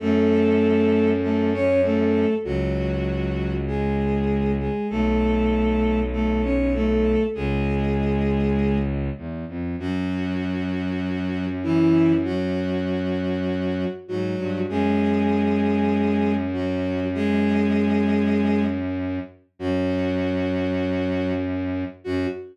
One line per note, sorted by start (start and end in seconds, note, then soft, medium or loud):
0.00 2.26 F#2 loud
0.00 1.10 A3 medium
0.00 1.10 A4 medium
1.22 1.50 A3 medium
1.22 1.50 A4 medium
1.53 1.81 C#4 medium
1.53 1.81 C#5 medium
1.84 2.34 A3 medium
1.84 2.34 A4 medium
2.44 4.69 C#2 medium
2.44 3.52 F#3 medium
2.44 3.52 F#4 medium
3.67 4.52 G#3 medium
3.67 4.52 G#4 medium
4.59 4.87 G#3 medium
4.59 4.87 G#4 medium
4.90 7.16 B1 medium
4.90 5.99 A3 medium
4.90 5.99 A4 medium
6.12 6.41 A3 medium
6.12 6.41 A4 medium
6.43 6.73 C#4 medium
6.43 6.73 C#5 medium
6.74 7.23 A3 medium
6.74 7.23 A4 medium
7.35 9.10 C#2 medium
7.35 8.76 G#3 medium
7.35 8.76 G#4 medium
9.17 9.45 E2 medium
9.48 9.76 F2 medium
9.78 13.85 F#2 medium
9.78 11.45 F#3 medium
9.78 11.45 F#4 medium
11.63 12.13 E3 medium
11.63 12.13 E4 medium
12.25 13.84 F#3 medium
12.25 13.84 F#4 medium
14.08 14.36 G#2 medium
14.08 14.59 F#3 medium
14.08 14.59 F#4 medium
14.39 14.66 G2 medium
14.69 19.19 F#2 medium
14.69 16.33 G#3 medium
14.69 16.33 G#4 medium
16.53 17.04 F#3 medium
16.53 17.04 F#4 medium
17.14 18.63 G#3 medium
17.14 18.63 G#4 loud
19.59 21.84 F#2 medium
19.59 21.31 F#3 medium
19.59 21.31 F#4 medium
22.04 22.27 F#2 medium
22.04 22.26 F#4 loud